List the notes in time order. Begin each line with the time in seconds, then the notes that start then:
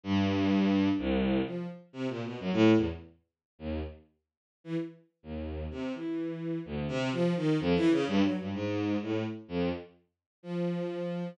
0.04 G2
0.98 C2
1.45 F3
1.93 C3
2.09 A#2
2.24 B2
2.40 F#2
2.52 A2
2.76 E2
3.59 D#2
4.64 E3
5.23 D#2
5.71 C3
5.94 E3
6.65 D2
6.88 C3
7.12 F3
7.36 D#3
7.60 F2
7.75 E3
7.91 C#3
8.07 G2
8.23 F#3
8.39 G2
8.54 G#2
9.02 A2
9.48 F2
10.43 F3